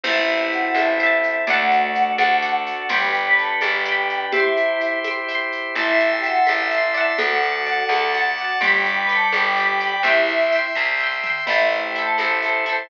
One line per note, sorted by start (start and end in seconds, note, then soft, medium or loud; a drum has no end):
0.03 0.68 A1 loud
0.03 1.45 C4 medium
0.03 1.45 E4 loud
0.03 0.27 E4 loud
0.03 0.90 E4 loud
0.03 1.45 A4 medium
0.03 0.70 C5 loud
0.03 0.27 E5 loud
0.03 0.70 E5 loud
0.03 crash loud
0.03 low conga loud
0.03 shaker medium
0.10 0.70 A5 loud
0.28 0.39 E4 loud
0.28 0.39 E5 loud
0.28 shaker medium
0.40 0.51 G4 loud
0.40 0.51 G5 loud
0.52 0.75 F#4 loud
0.52 0.75 F#5 loud
0.52 shaker medium
0.75 1.39 A1 medium
0.75 1.39 E4 medium
0.75 0.97 C5 medium
0.75 1.39 E5 loud
0.75 high conga medium
0.75 shaker medium
0.79 0.97 E5 medium
0.79 0.97 A5 medium
0.99 1.44 C5 medium
0.99 1.44 E5 loud
0.99 shaker medium
1.06 1.44 A5 medium
1.23 shaker medium
1.47 2.12 D2 medium
1.47 2.72 A3 loud
1.47 2.89 D4 medium
1.47 2.54 F#4 loud
1.47 2.89 F#4 medium
1.47 2.89 A4 medium
1.47 2.13 D5 medium
1.47 2.54 F#5 loud
1.47 2.13 F#5 loud
1.47 low conga loud
1.47 shaker medium
1.53 2.13 A5 loud
1.71 shaker medium
1.95 shaker medium
2.18 2.83 D2 medium
2.18 2.40 D5 loud
2.18 2.40 F#5 loud
2.18 high conga medium
2.18 shaker medium
2.25 2.40 A5 loud
2.42 2.86 D5 medium
2.42 2.86 F#5 medium
2.42 shaker medium
2.49 2.86 A5 medium
2.66 2.86 F#4 loud
2.66 2.86 F#5 loud
2.66 shaker medium
2.89 3.53 G1 medium
2.89 4.18 G3 loud
2.89 4.32 D4 medium
2.89 3.12 G4 loud
2.89 4.32 G4 medium
2.89 4.32 B4 medium
2.89 3.55 D5 loud
2.89 3.12 G5 loud
2.89 3.55 G5 loud
2.89 low conga loud
2.89 shaker medium
2.96 3.55 B5 loud
3.14 3.25 G4 loud
3.14 3.25 G5 loud
3.14 shaker medium
3.26 3.37 B4 loud
3.26 3.37 B5 loud
3.38 3.57 A4 loud
3.38 3.57 A5 loud
3.38 shaker medium
3.61 4.26 G1 medium
3.61 4.25 G4 loud
3.61 3.84 D5 medium
3.61 4.25 G5 loud
3.61 3.84 G5 medium
3.61 high conga medium
3.61 shaker medium
3.68 3.84 B5 medium
3.85 4.29 D5 loud
3.85 4.29 G5 medium
3.85 shaker medium
3.92 4.29 B5 medium
4.09 shaker medium
4.32 4.92 E4 loud
4.32 5.75 E4 medium
4.32 4.53 G4 loud
4.32 5.75 G4 medium
4.32 5.75 C5 medium
4.32 4.92 E5 loud
4.32 4.99 E5 loud
4.32 low conga loud
4.32 shaker medium
4.37 4.99 G5 medium
4.37 4.99 C6 loud
4.56 4.80 E4 loud
4.56 shaker medium
4.80 shaker medium
5.04 5.26 E5 medium
5.04 5.26 G5 loud
5.04 high conga medium
5.04 shaker medium
5.11 5.26 C6 medium
5.28 5.72 E5 medium
5.28 5.72 G5 loud
5.28 shaker medium
5.35 5.72 C6 loud
5.52 shaker medium
5.75 6.40 A1 medium
5.75 5.98 E4 loud
5.75 6.61 E4 loud
5.75 5.98 E5 loud
5.75 6.20 E5 loud
5.75 7.18 E5 medium
5.75 7.18 A5 medium
5.75 7.18 C6 medium
5.75 low conga medium
5.75 shaker medium
5.79 6.20 A5 loud
5.79 6.20 C6 loud
6.00 6.11 E4 loud
6.00 6.11 E5 loud
6.00 shaker medium
6.12 6.23 G4 loud
6.12 6.23 G5 loud
6.23 6.46 F#4 loud
6.23 6.45 E5 medium
6.23 6.46 F#5 loud
6.23 6.45 A5 medium
6.23 shaker medium
6.30 6.45 C6 medium
6.47 7.13 A1 medium
6.47 7.11 E4 loud
6.47 6.69 E5 medium
6.47 7.11 E5 loud
6.47 6.69 A5 medium
6.47 high conga medium
6.47 shaker medium
6.53 6.69 C6 medium
6.71 6.93 E5 medium
6.71 6.93 A5 medium
6.71 shaker medium
6.78 6.93 C6 medium
6.94 7.62 D5 loud
6.94 7.62 F#5 loud
6.94 shaker medium
7.01 7.62 A5 loud
7.18 7.83 D2 medium
7.18 8.25 F#4 loud
7.18 8.43 A4 loud
7.18 8.60 D5 medium
7.18 8.25 F#5 loud
7.18 8.60 F#5 medium
7.18 8.60 A5 medium
7.18 low conga loud
7.18 shaker medium
7.42 shaker medium
7.66 7.88 D5 medium
7.66 7.88 F#5 medium
7.66 shaker medium
7.73 7.88 A5 medium
7.89 8.53 D2 medium
7.89 8.11 D5 medium
7.89 8.11 F#5 medium
7.89 high conga medium
7.89 shaker medium
7.96 8.11 A5 medium
8.14 8.36 D5 medium
8.14 8.36 F#5 medium
8.14 shaker medium
8.21 8.36 A5 medium
8.38 8.58 F#4 loud
8.38 8.60 D5 medium
8.38 8.58 F#5 loud
8.38 8.60 F#5 medium
8.38 shaker medium
8.44 8.60 A5 medium
8.61 9.25 G1 medium
8.61 9.90 G3 loud
8.61 8.83 G4 loud
8.61 9.05 D5 loud
8.61 10.03 D5 medium
8.61 10.03 G5 medium
8.61 8.83 G5 loud
8.61 9.05 G5 loud
8.61 10.03 B5 medium
8.61 low conga loud
8.61 shaker medium
8.67 9.05 B5 loud
8.85 8.96 G4 loud
8.85 8.96 G5 loud
8.85 shaker medium
8.97 9.09 B4 loud
8.97 9.09 B5 loud
9.09 9.28 A4 loud
9.09 9.31 D5 medium
9.09 9.31 G5 medium
9.09 9.28 A5 loud
9.09 shaker medium
9.15 9.31 B5 medium
9.32 9.97 G1 medium
9.32 9.97 G4 loud
9.32 9.55 D5 medium
9.32 9.97 G5 loud
9.32 high conga medium
9.32 shaker medium
9.37 9.55 G5 medium
9.37 9.55 B5 medium
9.57 9.78 D5 medium
9.57 9.78 G5 medium
9.57 shaker medium
9.63 9.78 B5 medium
9.80 10.02 D5 medium
9.80 10.02 G5 medium
9.80 shaker medium
9.87 10.02 B5 medium
10.03 10.67 C2 medium
10.03 10.64 E4 loud
10.03 10.26 G4 loud
10.03 11.45 E5 medium
10.03 10.48 E5 loud
10.03 10.64 E5 loud
10.03 11.45 G5 medium
10.03 11.45 C6 medium
10.03 low conga medium
10.03 shaker medium
10.07 10.48 G5 loud
10.07 10.48 C6 medium
10.28 10.52 E4 loud
10.28 shaker medium
10.52 10.74 E5 medium
10.52 10.74 G5 medium
10.52 shaker medium
10.59 10.74 C6 medium
10.75 11.41 C2 medium
10.75 10.97 E5 medium
10.75 10.97 G5 medium
10.75 kick medium
10.82 10.97 C6 medium
11.00 11.22 E5 medium
11.00 11.22 G5 medium
11.00 floor tom medium
11.07 11.22 C6 medium
11.23 11.45 E5 medium
11.23 11.45 G5 medium
11.23 mid tom medium
11.30 11.45 C6 medium
11.46 12.12 A1 medium
11.46 12.25 A3 loud
11.46 12.87 E4 medium
11.46 11.91 E4 loud
11.46 11.66 E4 medium
11.46 12.87 A4 medium
11.46 12.87 C5 medium
11.46 11.66 E5 loud
11.46 crash medium
11.46 low conga medium
11.46 shaker medium
11.50 11.91 A4 loud
11.50 11.91 C5 medium
11.71 11.82 E4 medium
11.71 11.82 E5 medium
11.71 shaker medium
11.83 11.94 G4 medium
11.83 11.94 G5 loud
11.95 12.17 E4 medium
11.95 12.17 A4 loud
11.95 12.17 A4 medium
11.95 12.17 A5 loud
11.95 shaker medium
12.02 12.17 C5 medium
12.18 12.83 A1 medium
12.18 12.40 E4 medium
12.18 12.82 A4 medium
12.18 12.40 A4 medium
12.18 12.82 A5 loud
12.18 high conga medium
12.18 shaker medium
12.24 12.40 C5 medium
12.42 12.64 E4 medium
12.42 12.64 A4 medium
12.42 shaker medium
12.49 12.64 C5 medium
12.66 12.88 E4 medium
12.66 12.88 A4 medium
12.66 shaker medium
12.72 12.88 C5 medium